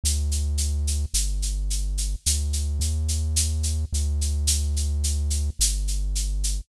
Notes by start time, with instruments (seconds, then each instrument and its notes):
0.04 synth bass 1 D2, shaker
0.31 shaker
0.58 shaker
0.87 shaker
1.14 synth bass 1 G1, shaker
1.42 shaker
1.70 shaker
1.97 shaker
2.26 synth bass 1 D2, shaker
2.53 shaker
2.80 synth bass 1 D#2, shaker
3.08 shaker
3.36 shaker
3.63 shaker
3.93 synth bass 1 D2, shaker
4.21 shaker
4.47 shaker
4.76 shaker
5.04 shaker
5.30 shaker
5.59 synth bass 1 G1, shaker
5.87 shaker
6.15 shaker
6.44 shaker